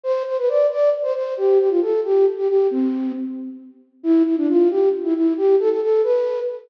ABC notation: X:1
M:6/8
L:1/16
Q:3/8=90
K:C
V:1 name="Flute"
c2 c B d2 d2 z c c2 | G2 G F A2 G2 z G G2 | C4 z8 | E2 E D F2 G2 z E E2 |
G2 A A A2 B4 z2 |]